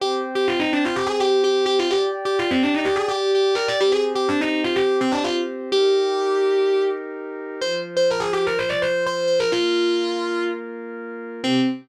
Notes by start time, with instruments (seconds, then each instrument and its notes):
0.00 pad 2 (warm) C4 C5 G5, distortion guitar G4
0.35 distortion guitar G4
0.48 distortion guitar F4
0.60 distortion guitar D#4
0.73 distortion guitar D4
0.85 distortion guitar F4
0.96 distortion guitar G4
1.07 distortion guitar G#4
1.20 distortion guitar G4
1.44 distortion guitar G4
1.66 distortion guitar G4
1.79 distortion guitar F4
1.91 distortion guitar G4, pad 2 (warm) G4 D5 G5
2.25 distortion guitar G4
2.39 distortion guitar F4
2.51 distortion guitar C4
2.63 distortion guitar D4
2.74 distortion guitar D#4
2.85 distortion guitar G4
2.96 distortion guitar G#4
3.08 distortion guitar G4
3.35 distortion guitar G4
3.55 distortion guitar A#4
3.68 distortion guitar D5
3.80 pad 2 (warm) C4 G4 C5, distortion guitar G4
3.92 distortion guitar G#4
4.15 distortion guitar G4
4.29 distortion guitar D4
4.41 distortion guitar D#4
4.64 distortion guitar F4
4.76 distortion guitar G4
5.01 distortion guitar C4
5.12 distortion guitar D4
5.24 distortion guitar F4
5.71 pad 2 (warm) D#4 G4 A#4, distortion guitar G4
7.61 pad 2 (warm) F3 F4 C5, distortion guitar C5
7.97 distortion guitar C5
8.11 distortion guitar A#4
8.20 distortion guitar G#4
8.33 distortion guitar G4
8.47 distortion guitar A#4
8.59 distortion guitar C5
8.69 distortion guitar D5
8.82 distortion guitar C5
9.06 distortion guitar C5
9.27 distortion guitar C5
9.40 distortion guitar A#4
9.52 pad 2 (warm) A#3 F4 A#4, distortion guitar F4
11.43 pad 2 (warm) C3 C4 G4, distortion guitar C4